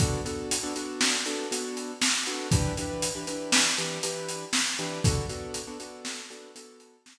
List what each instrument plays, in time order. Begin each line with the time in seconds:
0.00 acoustic grand piano B3 D4 F#4 A4, kick, closed hi-hat
0.25 acoustic grand piano B3 D4 F#4 A4, closed hi-hat
0.51 closed hi-hat
0.63 acoustic grand piano B3 D4 F#4 A4
0.76 acoustic grand piano B3 D4 F#4 A4, closed hi-hat
1.01 snare
1.26 acoustic grand piano B3 D4 F#4 A4, closed hi-hat
1.51 acoustic grand piano B3 D4 F#4 A4, closed hi-hat
1.77 closed hi-hat
2.01 snare
2.26 acoustic grand piano B3 D4 F#4 A4, closed hi-hat
2.51 acoustic grand piano E3 D4 G4 B4, kick, closed hi-hat
2.77 acoustic grand piano E3 D4 G4 B4, closed hi-hat
3.02 closed hi-hat
3.15 acoustic grand piano E3 D4 G4 B4
3.27 acoustic grand piano E3 D4 G4 B4, closed hi-hat
3.52 snare
3.78 acoustic grand piano E3 D4 G4 B4, closed hi-hat
4.03 acoustic grand piano E3 D4 G4 B4, closed hi-hat
4.29 closed hi-hat
4.53 snare
4.79 acoustic grand piano E3 D4 G4 B4, closed hi-hat
5.04 acoustic grand piano B3 D4 F#4 A4, kick, closed hi-hat
5.29 acoustic grand piano B3 D4 F#4 A4, closed hi-hat
5.54 closed hi-hat
5.67 acoustic grand piano B3 D4 F#4 A4
5.80 acoustic grand piano B3 D4 F#4 A4, closed hi-hat
6.05 snare
6.30 acoustic grand piano B3 D4 F#4 A4, closed hi-hat
6.55 acoustic grand piano B3 D4 F#4 A4, closed hi-hat
6.80 closed hi-hat
7.06 snare